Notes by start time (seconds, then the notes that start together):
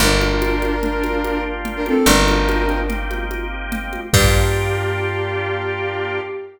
0.00 G1 A#3 D4 F4 G4 A#4, low conga
0.21 high conga
0.42 high conga
0.62 high conga
0.83 A#3 D4 F4 G4, low conga
1.04 high conga
1.24 high conga
1.65 low conga
1.76 D4 A#4
1.86 C4 A4, high conga
2.06 G1 A#3 C4 D4 D#4 G4 A#4, low conga
2.28 high conga
2.49 high conga
2.69 high conga
2.88 A#3 C4 D#4 G4, low conga
3.11 high conga
3.31 high conga
3.72 low conga
3.93 high conga
4.13 G2 A#3 D4 F4 G4, kick, crash